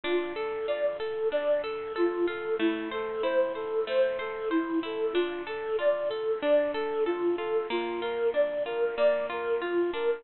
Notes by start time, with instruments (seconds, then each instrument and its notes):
0.03 pizzicato strings D4, flute F4
0.36 pizzicato strings A4, flute A4
0.67 pizzicato strings F4, flute D5
0.99 flute A4, pizzicato strings A4
1.32 pizzicato strings D4, flute D5
1.63 flute A4, pizzicato strings A4
1.96 flute F4, pizzicato strings A4
2.27 pizzicato strings F4, flute A4
2.59 pizzicato strings A3, flute E4
2.91 flute A4, pizzicato strings C5
3.23 pizzicato strings E4, flute C5
3.55 flute A4, pizzicato strings C5
3.87 pizzicato strings A3, flute C5
4.19 flute A4, pizzicato strings C5
4.50 flute E4, pizzicato strings C5
4.83 pizzicato strings E4, flute A4
5.13 pizzicato strings D4, flute F4
5.47 pizzicato strings A4, flute A4
5.79 pizzicato strings F4, flute D5
6.09 flute A4, pizzicato strings A4
6.42 pizzicato strings D4, flute D5
6.74 pizzicato strings A4, flute A4
7.06 flute F4, pizzicato strings A4
7.38 pizzicato strings F4, flute A4
7.70 pizzicato strings A#3, flute F4
8.01 pizzicato strings F4, flute A#4
8.34 pizzicato strings D4, flute D5
8.65 pizzicato strings F4, flute A#4
8.97 pizzicato strings A#3, flute D5
9.30 pizzicato strings F4, flute A#4
9.61 flute F4, pizzicato strings F4
9.93 pizzicato strings D4, flute A#4